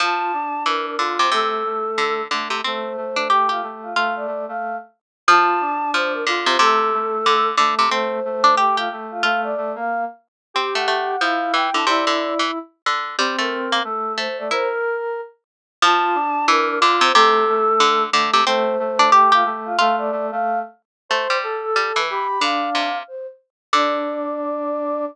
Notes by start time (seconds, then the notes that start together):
0.00 F3 F4 A5
0.33 D4
0.66 E3 A#4
0.86 A#4
0.98 D3 F4
1.19 C3 C5
1.32 C3 A3 A4
1.65 A3
1.98 D3
2.31 D3 A3
2.50 C3
2.64 A3 C4 C5
2.97 A3
3.16 D4
3.29 G4
3.49 F4 G4
3.62 A3
3.83 F4
3.95 A3 F4 F5
4.16 D5
4.27 A3
4.48 A3 F5
5.28 F3 F4 A5
5.61 D4
5.93 F3 C5
6.13 A#4
6.27 D3 F4
6.46 C3 C5
6.59 C3 A3 A4
6.93 A3
7.26 D3
7.57 D3 A3
7.79 C3
7.89 A3 C4 C5
8.25 A3
8.44 D4
8.57 G4
8.77 F4 G4
8.92 A3
9.11 F4
9.23 A3 F4 F5
9.43 D5
9.57 A3
9.75 A#3 F5
10.54 C4 G4
10.75 A3 F#5
10.88 A3
11.20 F3 E4 F5
11.54 E3 G5
11.73 D3 E4 A5
11.86 C3 E4 D5
12.07 D3
12.39 E3
12.86 D3
13.18 G3 C4
13.39 A3 A#4
13.72 A#3
13.84 A3 A4
14.17 A3 C5
14.38 A3 D5
14.51 E4 A#4 C5
14.70 A#4
15.82 F3 F4 A5
16.15 D4
16.48 E3 A#4
16.68 A#4
16.80 D3 F4
17.01 C3 C5
17.14 C3 A3 A4
17.48 A3
17.80 D3
18.12 D3 A3
18.34 C3
18.46 A3 C4 C5
18.79 A3
18.99 D4
19.12 G4
19.32 F4 G4
19.45 A3
19.65 F4
19.78 A3 F4 F5
19.98 D5
20.12 A3
20.31 A3 F5
21.09 A3 C5
21.30 G3
21.43 A4
21.63 A4
21.76 G3
21.96 E3 B4
22.09 G4 B5
22.40 D3 D4 F5
22.75 C3
23.08 C5
23.73 D3 D4 D5